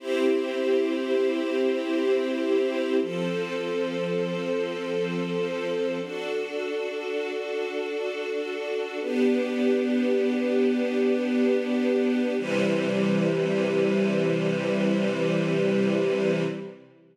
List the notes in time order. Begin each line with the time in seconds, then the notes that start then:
0.00 C4 E4 G4
3.00 F3 C4 A4
6.00 D4 F#4 A4
8.99 B3 D4 G4
12.38 C3 E3 G3